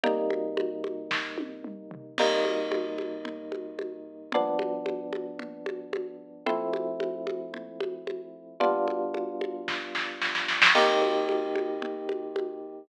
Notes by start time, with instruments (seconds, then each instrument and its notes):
0.03 electric piano 1 C3 G3 A#3 D#4, low conga
0.30 high conga
0.57 high conga
0.84 high conga
1.11 kick, snare
1.38 high tom
1.64 mid tom
1.91 floor tom
2.18 electric piano 1 C3 G3 A#3 D#4, crash, low conga
2.45 high conga
2.72 high conga
2.98 high conga
3.25 low conga
3.52 high conga
3.79 high conga
4.32 electric piano 1 G2 F3 B3 D4, low conga
4.59 high conga
4.86 high conga
5.13 high conga
5.39 low conga
5.66 high conga
5.93 high conga
6.46 electric piano 1 F3 A3 C4 E4, low conga
6.73 high conga
7.00 high conga
7.27 high conga
7.54 low conga
7.80 high conga
8.07 high conga
8.60 electric piano 1 G3 B3 D4 F4, low conga
8.88 high conga
9.14 high conga
9.41 high conga
9.68 kick, snare
9.95 snare
10.22 snare
10.35 snare
10.48 snare
10.62 snare
10.75 electric piano 1 C3 A#3 D#4 G4, crash, low conga
11.02 high conga
11.29 high conga
11.55 high conga
11.82 low conga
12.09 high conga
12.36 high conga